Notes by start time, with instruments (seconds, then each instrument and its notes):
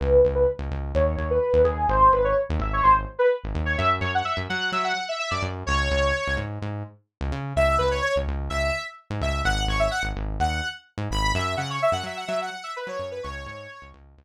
0.00 synth bass 1 C#2, lead 2 (sawtooth) B4
0.25 synth bass 1 C#2
0.35 lead 2 (sawtooth) B4
0.59 synth bass 1 C#2
0.71 synth bass 1 C#2
0.95 synth bass 1 D#2, lead 2 (sawtooth) C#5
1.17 synth bass 1 D#2
1.30 lead 2 (sawtooth) B4
1.53 synth bass 1 D#2
1.64 synth bass 1 D#2, lead 2 (sawtooth) G#4
1.88 synth bass 1 G#1, lead 2 (sawtooth) C5
2.12 synth bass 1 G#1, lead 2 (sawtooth) B4
2.24 lead 2 (sawtooth) C#5
2.49 synth bass 1 D#2
2.59 synth bass 1 G#1, lead 2 (sawtooth) E5
2.73 lead 2 (sawtooth) C#5
2.83 synth bass 1 G#1, lead 2 (sawtooth) C5
3.19 lead 2 (sawtooth) B4
3.44 synth bass 1 G#1
3.55 synth bass 1 D#2
3.65 lead 2 (sawtooth) C#5
3.78 synth bass 1 F#2, lead 2 (sawtooth) E5
4.01 synth bass 1 F#2, lead 2 (sawtooth) C#5
4.14 lead 2 (sawtooth) F#5
4.25 lead 2 (sawtooth) E5
4.37 synth bass 1 F#2
4.49 synth bass 1 F#3, lead 2 (sawtooth) F#5
4.72 synth bass 1 F#3, lead 2 (sawtooth) E5
4.84 lead 2 (sawtooth) F#5
5.09 lead 2 (sawtooth) E5
5.19 lead 2 (sawtooth) E5
5.31 synth bass 1 F#2, lead 2 (sawtooth) D5
5.42 synth bass 1 F#2
5.66 synth bass 1 C#2, lead 2 (sawtooth) C#5
5.91 synth bass 1 C#2
6.27 synth bass 1 C#2
6.37 synth bass 1 G#2
6.62 synth bass 1 G#2
7.21 synth bass 1 C#2
7.32 synth bass 1 C#3
7.56 synth bass 1 C#2, lead 2 (sawtooth) E5
7.78 synth bass 1 C#2, lead 2 (sawtooth) B4
7.91 lead 2 (sawtooth) C#5
8.02 lead 2 (sawtooth) C#5
8.16 synth bass 1 C#2
8.27 synth bass 1 C#2
8.50 synth bass 1 C#2, lead 2 (sawtooth) E5
9.10 synth bass 1 G#2
9.21 synth bass 1 C#2, lead 2 (sawtooth) E5
9.45 synth bass 1 G#1, lead 2 (sawtooth) F#5
9.68 synth bass 1 G#1, lead 2 (sawtooth) C#5
9.79 lead 2 (sawtooth) E5
9.91 lead 2 (sawtooth) F#5
10.03 synth bass 1 G#1
10.16 synth bass 1 G#1
10.40 synth bass 1 D#2, lead 2 (sawtooth) F#5
10.98 synth bass 1 G#2
11.11 synth bass 1 G#1, lead 2 (sawtooth) B5
11.34 synth bass 1 F#2, lead 2 (sawtooth) E5
11.57 synth bass 1 C#3, lead 2 (sawtooth) F#5
11.70 lead 2 (sawtooth) C#5
11.82 lead 2 (sawtooth) E5
11.92 synth bass 1 F#2, lead 2 (sawtooth) F#5
12.03 synth bass 1 F#3, lead 2 (sawtooth) E5
12.17 lead 2 (sawtooth) F#5
12.28 synth bass 1 F#3, lead 2 (sawtooth) E5
12.42 lead 2 (sawtooth) F#5
12.63 lead 2 (sawtooth) E5
12.76 lead 2 (sawtooth) B4
12.87 synth bass 1 F#3, lead 2 (sawtooth) C#5
12.99 synth bass 1 F#2
13.11 lead 2 (sawtooth) B4
13.23 synth bass 1 C#2, lead 2 (sawtooth) C#5
13.46 synth bass 1 G#2
13.82 synth bass 1 C#2
13.94 synth bass 1 C#2
14.18 synth bass 1 C#2